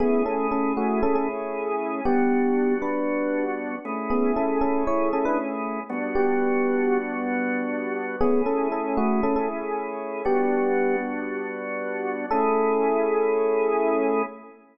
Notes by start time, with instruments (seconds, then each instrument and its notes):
0.00 drawbar organ A3 C#4 E4 G#4, electric piano 1 B3 G#4
0.26 electric piano 1 C#4 A4
0.51 electric piano 1 C#4 A4
0.77 electric piano 1 A3 F#4
1.03 electric piano 1 C#4 A4
1.15 electric piano 1 C#4 A4
2.05 drawbar organ G3 B3 D4 F#4, electric piano 1 B3 G4
2.82 electric piano 1 D4 B4
3.85 drawbar organ A3 C#4 E4 G#4
4.10 electric piano 1 B3 G#4
4.36 electric piano 1 C#4 A4
4.61 electric piano 1 C#4 A4
4.87 electric piano 1 E4 C#5
5.13 electric piano 1 C#4 A4
5.25 electric piano 1 D4 B4
5.90 drawbar organ G3 B3 D4 F#4
6.15 electric piano 1 B3 G4
8.21 drawbar organ A3 C#4 E4 G#4, electric piano 1 B3 G#4
8.46 electric piano 1 C#4 A4
8.72 electric piano 1 C#4 A4
8.97 electric piano 1 A3 F#4
9.23 electric piano 1 C#4 A4
9.36 electric piano 1 C#4 A4
10.25 drawbar organ G3 B3 D4 F#4, electric piano 1 B3 G4
12.31 drawbar organ A3 C#4 E4 G#4, electric piano 1 A4